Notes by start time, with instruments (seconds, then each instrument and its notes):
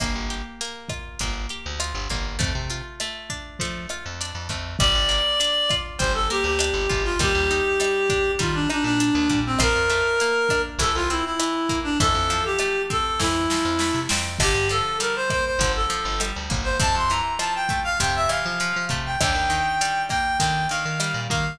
0.00 electric bass (finger) G1, acoustic guitar (steel) A#3, kick, cross-stick, closed hi-hat
0.15 electric bass (finger) G1
0.30 acoustic guitar (steel) G4, closed hi-hat
0.61 acoustic guitar (steel) A#3, closed hi-hat
0.89 acoustic guitar (steel) F4, kick, cross-stick, closed hi-hat
1.19 electric bass (finger) G1, acoustic guitar (steel) A#3, kick, closed hi-hat
1.49 acoustic guitar (steel) G4, closed hi-hat
1.66 electric bass (finger) D2
1.80 acoustic guitar (steel) F4, cross-stick, closed hi-hat
1.95 electric bass (finger) G1
2.10 electric bass (finger) G1, acoustic guitar (steel) A#3, kick, closed hi-hat
2.39 electric bass (finger) F2, acoustic guitar (steel) A3, kick, closed hi-hat
2.55 electric bass (finger) C3
2.70 acoustic guitar (steel) F4, closed hi-hat
3.00 acoustic guitar (steel) A3, cross-stick, closed hi-hat
3.30 acoustic guitar (steel) D4, kick, closed hi-hat
3.59 electric bass (finger) F3, acoustic guitar (steel) A3, kick, closed hi-hat
3.89 acoustic guitar (steel) F4, cross-stick, closed hi-hat
4.06 electric bass (finger) F2
4.21 acoustic guitar (steel) D4, closed hi-hat
4.35 electric bass (finger) F2
4.49 electric bass (finger) F2, acoustic guitar (steel) A3, kick, closed hi-hat
4.79 electric bass (finger) G1, acoustic guitar (steel) G3, clarinet D5, kick, cross-stick, closed hi-hat
4.95 electric bass (finger) G1
5.09 acoustic guitar (steel) A#3, closed hi-hat
5.40 acoustic guitar (steel) D4, closed hi-hat
5.70 acoustic guitar (steel) F4, kick, cross-stick, closed hi-hat
5.98 electric bass (finger) G1, acoustic guitar (steel) G3, clarinet C5, kick, closed hi-hat
6.14 clarinet A4
6.30 acoustic guitar (steel) A#3, clarinet G4, closed hi-hat
6.44 electric bass (finger) D2, clarinet G4
6.59 acoustic guitar (steel) D4, cross-stick, closed hi-hat
6.74 electric bass (finger) G1
6.90 electric bass (finger) G1, acoustic guitar (steel) F4, kick, closed hi-hat
7.04 clarinet F4
7.19 electric bass (finger) D#2, acoustic guitar (steel) G3, clarinet G4, kick, closed hi-hat
7.35 electric bass (finger) D#2
7.51 acoustic guitar (steel) D#4, closed hi-hat
7.80 acoustic guitar (steel) G3, cross-stick, closed hi-hat
8.10 acoustic guitar (steel) D4, kick, closed hi-hat
8.39 electric bass (finger) D#3, acoustic guitar (steel) G3, clarinet F4, kick, closed hi-hat
8.54 clarinet D4
8.70 clarinet D4, acoustic guitar (steel) D#4, cross-stick, closed hi-hat
8.84 electric bass (finger) A#2, clarinet D4
9.00 acoustic guitar (steel) D4, closed hi-hat
9.15 electric bass (finger) D#2
9.29 electric bass (finger) A#2, acoustic guitar (steel) G3, kick, closed hi-hat
9.46 clarinet C4
9.59 electric bass (finger) A#1, acoustic guitar (steel) F3, clarinet A#4, kick, cross-stick, closed hi-hat
9.76 electric bass (finger) F2
9.89 acoustic guitar (steel) A3, closed hi-hat
10.20 acoustic guitar (steel) A#3, closed hi-hat
10.49 acoustic guitar (steel) D4, kick, cross-stick, closed hi-hat
10.79 electric bass (finger) C2, acoustic guitar (steel) E3, clarinet A4, kick, closed hi-hat
10.95 electric bass (finger) C2, clarinet F4
11.10 acoustic guitar (steel) C4, clarinet E4, closed hi-hat
11.25 clarinet E4
11.39 acoustic guitar (steel) E3, cross-stick, closed hi-hat
11.69 acoustic guitar (steel) A#3, kick, closed hi-hat
11.84 clarinet D4
12.00 electric bass (finger) F2, acoustic guitar (steel) E3, clarinet A4, kick, closed hi-hat
12.15 electric bass (finger) F2
12.30 acoustic guitar (steel) F3, closed hi-hat
12.45 clarinet G4
12.59 acoustic guitar (steel) A3, cross-stick, closed hi-hat
12.90 acoustic guitar (steel) C4, clarinet A4, kick, closed hi-hat
13.20 electric bass (finger) F2, acoustic guitar (steel) E3, clarinet E4, kick, snare
13.50 acoustic guitar (steel) F3, snare
13.65 electric bass (finger) F2
13.79 acoustic guitar (steel) A3, snare
13.94 electric bass (finger) C3
14.09 electric bass (finger) F2, acoustic guitar (steel) C4, snare
14.39 electric bass (finger) G1, acoustic guitar (steel) D3, clarinet G4, kick, cross-stick, crash
14.54 electric bass (finger) G2
14.69 acoustic guitar (steel) F3, clarinet A4, closed hi-hat
15.00 acoustic guitar (steel) G3, clarinet A#4, closed hi-hat
15.16 clarinet C5
15.30 acoustic guitar (steel) A#3, clarinet C5, kick, cross-stick, closed hi-hat
15.46 clarinet C5
15.59 electric bass (finger) G1, acoustic guitar (steel) D3, kick, closed hi-hat
15.76 clarinet A4
15.90 acoustic guitar (steel) F3, closed hi-hat
16.05 electric bass (finger) G1
16.20 acoustic guitar (steel) G3, cross-stick, closed hi-hat
16.36 electric bass (finger) D2
16.50 electric bass (finger) G1, acoustic guitar (steel) A#3, kick, closed hi-hat
16.64 clarinet C5
16.80 electric bass (finger) F2, acoustic guitar (steel) C3, clarinet A5, kick, closed hi-hat
16.95 electric bass (finger) F2, clarinet C6
17.09 acoustic guitar (steel) E3, clarinet A#5, closed hi-hat
17.39 acoustic guitar (steel) F3, clarinet A5, cross-stick, closed hi-hat
17.55 clarinet G5
17.69 acoustic guitar (steel) A3, kick, closed hi-hat
17.84 clarinet F5
18.00 electric bass (finger) F2, acoustic guitar (steel) C3, clarinet G5, kick, closed hi-hat
18.16 clarinet E5
18.29 acoustic guitar (steel) E3, clarinet F5, cross-stick, closed hi-hat
18.46 electric bass (finger) F3
18.60 acoustic guitar (steel) F3, closed hi-hat
18.76 electric bass (finger) F3
18.89 electric bass (finger) C3, acoustic guitar (steel) A3, kick, closed hi-hat
19.06 clarinet G5
19.20 electric bass (finger) D#2, acoustic guitar (steel) D3, clarinet G5, kick, cross-stick, closed hi-hat
19.34 electric bass (finger) D#2
19.50 acoustic guitar (steel) D#3, closed hi-hat
19.81 acoustic guitar (steel) G3, closed hi-hat
20.09 acoustic guitar (steel) A#3, clarinet G5, kick, cross-stick, closed hi-hat
20.39 acoustic guitar (steel) D3, electric bass (finger) D#3, clarinet G5, kick, closed hi-hat
20.69 acoustic guitar (steel) D#3, clarinet F5, closed hi-hat
20.85 electric bass (finger) D#3
21.00 acoustic guitar (steel) G3, cross-stick, closed hi-hat
21.14 electric bass (finger) A#2
21.30 electric bass (finger) D#3, acoustic guitar (steel) A#3, clarinet F5, kick, closed hi-hat